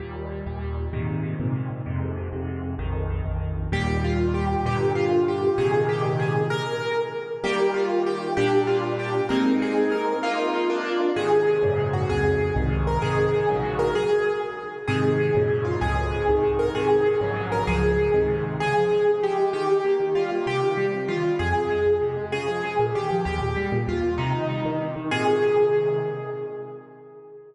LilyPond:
<<
  \new Staff \with { instrumentName = "Acoustic Grand Piano" } { \time 6/8 \key ees \major \tempo 4. = 129 r2. | r2. | r2. | r2. |
g'4 f'4 g'4 | g'4 f'4 g'4 | aes'4 g'4 aes'4 | bes'2 r4 |
g'4 f'4 g'4 | g'4 f'4 g'4 | bes'4 aes'4 bes'4 | f'2 r4 |
\key aes \major aes'2~ aes'8 ges'8 | aes'2~ aes'8 bes'8 | aes'2~ aes'8 bes'8 | aes'4. r4. |
aes'2~ aes'8 f'8 | aes'2~ aes'8 bes'8 | aes'2~ aes'8 bes'8 | aes'2 r4 |
aes'2 g'4 | g'2 f'4 | g'2 f'4 | aes'2 r4 |
aes'2 g'4 | g'2 f'4 | ees'2 r4 | aes'2. | }
  \new Staff \with { instrumentName = "Acoustic Grand Piano" } { \time 6/8 \key ees \major <ees, bes, g>4. <ees, bes, g>4. | <aes, bes, c ees>4. <aes, bes, c ees>4. | <f, aes, c>4. <f, aes, c>4. | <bes,, f, ees>4. <bes,, f, ees>4. |
<ees, bes, g>2. | <g, bes, d>2. | <aes, bes, c ees>2. | r2. |
<ees g bes>2. | <bes, g d'>2. | <aes bes c' ees'>2. | <bes ees'>4. <bes d' f'>4. |
\key aes \major <aes, c ees>4. <ges, aes, bes, des>4. | <des, f, aes,>4. <c, aes, ees>4. | <aes, c ees>4. <bes,, aes, des ges>4. | r2. |
<aes, c ees>4. <ges, aes, bes, des>4. | <des, f, aes,>4. <c, aes, ees>4. | <aes, c ees>4. <bes,, aes, des ges>4. | <des, aes, f>4. <aes, c ees>4. |
des8 f8 aes8 des8 f8 aes8 | ees8 g8 bes8 ees8 g8 bes8 | c8 ees8 g8 c8 ees8 g8 | f,8 c8 aes8 f,8 c8 aes8 |
des8 f8 aes8 bes,8 ees8 f8 | ees,8 bes,8 g8 bes,8 ees,8 bes,8 | c8 ees8 g8 ees8 c8 ees8 | <aes, bes, c ees>2. | }
>>